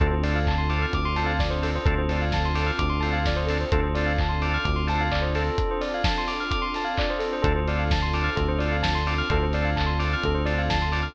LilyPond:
<<
  \new Staff \with { instrumentName = "Drawbar Organ" } { \time 4/4 \key d \minor \tempo 4 = 129 <c' d' f' a'>8 <c' d' f' a'>4 <c' d' f' a'>4 <c' d' f' a'>4 <c' d' f' a'>8 | <c' d' f' a'>8 <c' d' f' a'>4 <c' d' f' a'>4 <c' d' f' a'>4 <c' d' f' a'>8 | <c' d' f' a'>8 <c' d' f' a'>4 <c' d' f' a'>4 <c' d' f' a'>4 <c' d' f' a'>8 | r1 |
<c' d' f' a'>8 <c' d' f' a'>4 <c' d' f' a'>4 <c' d' f' a'>4 <c' d' f' a'>8 | <c' d' f' a'>8 <c' d' f' a'>4 <c' d' f' a'>4 <c' d' f' a'>4 <c' d' f' a'>8 | }
  \new Staff \with { instrumentName = "Tubular Bells" } { \time 4/4 \key d \minor a'16 c''16 d''16 f''16 a''16 c'''16 d'''16 f'''16 d'''16 c'''16 a''16 f''16 d''16 c''16 a'16 c''16 | a'16 c''16 d''16 f''16 a''16 c'''16 d'''16 f'''16 d'''16 c'''16 a''16 f''16 d''16 c''16 a'16 c''16 | a'16 c''16 d''16 f''16 a''16 c'''16 d'''16 f'''16 d'''16 c'''16 a''16 f''16 d''16 c''16 a'8~ | a'16 c''16 d''16 f''16 a''16 c'''16 d'''16 f'''16 d'''16 c'''16 a''16 f''16 d''16 c''16 a'16 c''16 |
a'16 c''16 d''16 f''16 a''16 c'''16 d'''16 f'''16 a'16 c''16 d''16 f''16 a''16 c'''16 d'''16 f'''16 | a'16 c''16 d''16 f''16 a''16 c'''16 d'''16 f'''16 a'16 c''16 d''16 f''16 a''16 c'''16 d'''16 f'''16 | }
  \new Staff \with { instrumentName = "Synth Bass 1" } { \clef bass \time 4/4 \key d \minor d,2 d,2 | d,2 d,2 | d,2 d,2 | r1 |
d,2 d,2 | d,2 d,2 | }
  \new Staff \with { instrumentName = "Pad 2 (warm)" } { \time 4/4 \key d \minor <c' d' f' a'>1 | <c' d' f' a'>1 | <c' d' f' a'>1 | <c' d' f' a'>1 |
<c' d' f' a'>1 | <c' d' f' a'>1 | }
  \new DrumStaff \with { instrumentName = "Drums" } \drummode { \time 4/4 <hh bd>8 hho8 <hc bd>8 hho8 <hh bd>8 hho8 <bd sn>8 hho8 | <hh bd>8 hho8 <bd sn>8 hho8 <hh bd>8 hho8 <bd sn>8 hho8 | <hh bd>8 hho8 <hc bd>8 hho8 <hh bd>8 hho8 <hc bd>8 hho8 | <hh bd>8 hho8 <bd sn>8 hho8 <hh bd>8 hho8 <hc bd>8 hho8 |
<hh bd>8 hho8 <bd sn>8 hho8 <hh bd>8 hho8 <bd sn>8 hho8 | <hh bd>8 hho8 <hc bd>8 hho8 <hh bd>8 hho8 <bd sn>8 hho8 | }
>>